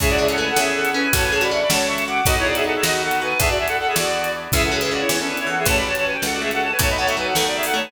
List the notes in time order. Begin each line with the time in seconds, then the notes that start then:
0.00 C#2 C#4 E4 G#4 E5, kick, closed hi-hat
0.09 F#4 D5
0.18 D4 G#4 E5
0.29 C#4 A4 F#5, closed hi-hat
0.38 A3 B4 G#5
0.49 A4 F#5
0.56 E2 C#4 E4 G#4 E5, snare
0.75 A4 F#5
0.85 closed hi-hat
0.94 C#4 B4 G#5
1.12 A1 C#4 F#4 A4 C#5 A5, kick, closed hi-hat
1.23 B4 G#5
1.32 G#4 C#5 A5
1.41 F#4 D5 B5, closed hi-hat
1.51 D4 E5 C#6
1.61 D5 B5
1.70 C#2 C#4 F#4 A4 C#5 A5, snare
1.87 E5 C#6
1.98 closed hi-hat
2.07 F#4 F#5 D6
2.25 B1 B3 D#4 F#4 A4 D#5, kick, closed hi-hat
2.37 E4 C#5
2.45 G#4 D5
2.55 F#4 G#4 E5, closed hi-hat
2.64 D#4 A4 F#5
2.75 G#4 E5
2.82 D#2 B3 D#4 F#4 A4 D#5, snare
3.03 A4 F#5
3.11 closed hi-hat
3.22 F#4 B4 G#5
3.39 E2 B3 D4 E4 G#4 A4 E5, kick, closed hi-hat
3.48 F#4 D5
3.58 G#4 E5
3.67 A4 F#5, closed hi-hat
3.78 A4 F#5
3.87 G#4 E5
3.96 E2 B3 D4 E4 F#4 G#4 D5, snare
4.24 closed hi-hat
4.52 C#2 E3 C#4 E4 G#4 E5, kick, closed hi-hat
4.64 A4 F#5
4.72 F#3 G#4 E5
4.81 E3 G#4 E5, closed hi-hat
4.91 C#3 F#4 D5
5.00 E4 C#5
5.09 E2 E3 E4 C#5, snare
5.19 C#4 A4
5.28 D4 B4
5.37 E4 C#5, closed hi-hat
5.47 E3 A4 F#5
5.58 G#4 E5
5.66 A1 A3 C#4 F#4 A4 C#5 A5, kick, closed hi-hat
5.76 D5 B5
5.87 C#5 A5
5.95 C#5 A5, closed hi-hat
6.05 B4 G#5
6.14 G5
6.22 C#2 A4 F#5, snare
6.32 F#4 D5
6.41 A3 G#4 E5
6.51 A4 F#5, closed hi-hat
6.62 C#5 A5
6.71 B4 G#5
6.79 B1 A3 B3 D#4 F#4 A4 C#5 A5, kick, closed hi-hat
6.89 D#5 B5
6.98 B3 C#5 A5
7.07 A3 E5 C#6, closed hi-hat
7.17 F#3 B4 G#5
7.27 A4 F#5
7.35 D#2 A3 A4 F#5, snare
7.47 D5
7.56 G#4 E5
7.63 A4 F#5, open hi-hat
7.74 A3 C#5 A5
7.84 B4 G#5